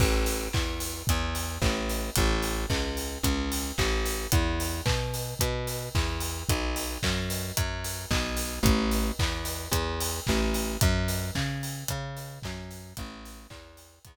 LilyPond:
<<
  \new Staff \with { instrumentName = "Electric Bass (finger)" } { \clef bass \time 4/4 \key a \major \tempo 4 = 111 a,,4 e,4 e,4 a,,4 | a,,4 cis,4 cis,4 a,,4 | e,4 b,4 b,4 e,4 | b,,4 fis,4 fis,4 b,,4 |
a,,4 e,4 e,4 a,,4 | fis,4 cis4 cis4 fis,4 | a,,4 e,4 e,4 r4 | }
  \new DrumStaff \with { instrumentName = "Drums" } \drummode { \time 4/4 <cymc bd>8 hho8 <hc bd>8 hho8 <hh bd>8 hho8 <hc bd>8 hho8 | <hh bd>8 hho8 <hc bd>8 hho8 <hh bd>8 hho8 <hc bd>8 hho8 | <hh bd>8 hho8 <hc bd>8 hho8 <hh bd>8 hho8 <hc bd>8 hho8 | <hh bd>8 hho8 <hc bd>8 hho8 <hh bd>8 hho8 <hc bd>8 hho8 |
<hh bd>8 hho8 <hc bd>8 hho8 <hh bd>8 hho8 <hc bd>8 hho8 | <hh bd>8 hho8 <hc bd>8 hho8 <hh bd>8 hho8 <hc bd>8 hho8 | <hh bd>8 hho8 <hc bd>8 hho8 <hh bd>4 r4 | }
>>